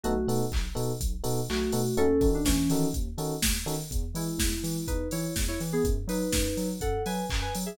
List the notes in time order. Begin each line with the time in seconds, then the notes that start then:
0.03 B1 A3 B3 D#4 F#4 A4, closed hi-hat
0.27 B2 B3 D#4 F#4 A4, open hi-hat
0.52 B1, kick, clap
0.75 B2 B3 D#4 F#4 A4, open hi-hat
1.01 B1, kick, closed hi-hat
1.24 B2 B3 D#4 F#4 A4, open hi-hat
1.49 B1 A3 F#4, clap
1.72 B2 B3 D#4 F#4 A4, open hi-hat
1.97 D#2 C#4 D#4 F#4 A4, closed hi-hat
2.21 D#3 C#4 D#4 F#4 A4, kick, open hi-hat
2.35 D4
2.45 D#2 E3 C#4, kick, snare
2.70 D#3 C#4 D#4 F#4 A4, open hi-hat
2.94 D#2, kick, closed hi-hat
3.18 D#3 C#4 D#4 F#4 A4, open hi-hat
3.42 D#2, kick, snare
3.66 D#3 C#4 D#4 F#4 A4, open hi-hat
3.91 E2, kick, closed hi-hat
4.14 E3 G#3 E4, open hi-hat
4.38 E2, kick, snare
4.63 E3, open hi-hat
4.87 E2 D#4 B4, kick, closed hi-hat
5.11 E3 E4 C#5, open hi-hat
5.36 E2, kick, snare
5.48 E4 C#5
5.60 E3, open hi-hat
5.73 B3 G#4
5.84 F#2, kick, closed hi-hat
6.07 F#3 D#4 B4, open hi-hat
6.32 F#2, kick, snare
6.57 F#3, open hi-hat
6.81 F#2 A4 F#5, kick, closed hi-hat
7.06 F#3 B4 G#5, open hi-hat
7.30 F#2, kick, clap
7.42 B4 G#5
7.55 F#3, open hi-hat
7.66 G#4 E5